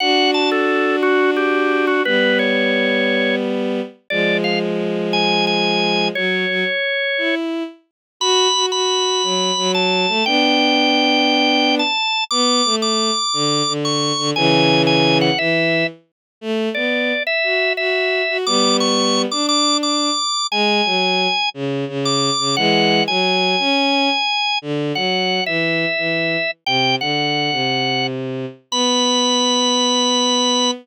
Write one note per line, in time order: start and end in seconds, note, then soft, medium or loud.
0.00 2.01 D4 medium
0.00 2.01 F#4 medium
0.00 0.31 F#5 loud
0.34 0.50 A5 medium
0.51 0.96 A4 medium
1.03 1.31 F#4 medium
1.37 1.86 G4 medium
1.87 2.03 F#4 medium
2.05 3.81 G3 medium
2.05 3.81 B3 medium
2.05 2.38 B4 loud
2.39 3.35 C#5 medium
4.10 6.09 F3 medium
4.10 6.09 G#3 medium
4.10 4.37 D5 medium
4.44 4.59 F5 medium
5.13 5.45 G#5 loud
5.47 6.08 G#5 medium
6.15 6.46 F#3 medium
6.15 7.35 C#5 medium
6.49 6.64 F#3 medium
7.18 7.63 E4 medium
8.20 8.48 F#4 loud
8.20 8.66 B5 loud
8.54 8.71 F#4 medium
8.72 9.22 F#4 medium
8.72 9.72 B5 medium
9.23 9.51 F#3 medium
9.57 10.06 F#3 loud
9.74 10.25 A5 medium
10.08 10.23 A3 medium
10.26 11.81 B3 medium
10.26 11.81 D4 medium
10.26 11.75 G5 loud
11.79 12.24 A5 medium
12.31 12.62 B3 loud
12.31 12.76 D6 loud
12.65 13.11 A3 medium
12.82 13.73 D6 medium
13.33 13.62 D3 medium
13.67 14.12 D3 medium
13.85 14.30 C#6 medium
14.18 14.33 D3 medium
14.36 15.30 C#3 loud
14.36 15.30 E3 loud
14.36 14.82 G#5 loud
14.87 15.18 G#5 loud
15.21 15.38 F#5 medium
15.38 15.84 E3 medium
15.38 15.87 E5 medium
16.41 16.69 A3 loud
16.75 17.13 B3 medium
16.75 17.23 D5 medium
17.27 17.73 E5 loud
17.44 17.72 F#4 medium
17.77 18.22 F#4 medium
17.77 18.38 E5 medium
18.29 18.45 F#4 medium
18.46 19.25 G3 medium
18.46 19.25 B3 medium
18.46 18.77 D6 loud
18.80 19.22 C#6 medium
19.31 20.10 D4 medium
19.31 19.46 D6 medium
19.49 19.77 D6 loud
19.83 20.47 D6 medium
20.51 20.81 G#3 loud
20.51 21.49 G#5 loud
20.85 21.27 F#3 medium
21.54 21.85 C#3 medium
21.88 22.30 C#3 medium
22.05 22.56 D6 medium
22.39 22.56 C#3 medium
22.56 23.01 E3 medium
22.56 23.01 G#3 loud
22.56 23.04 F#5 loud
23.08 23.56 F#3 medium
23.08 24.59 G#5 medium
23.59 24.09 C#4 loud
24.62 24.92 D3 medium
24.95 25.40 F#3 medium
24.95 25.44 F#5 medium
25.46 25.85 E3 medium
25.46 26.51 E5 medium
25.98 26.37 E3 medium
26.66 26.95 C3 medium
26.66 26.96 G5 loud
27.01 27.50 D3 medium
27.01 28.07 F#5 medium
27.52 28.46 C3 medium
28.71 30.71 B3 loud
28.71 30.71 B5 loud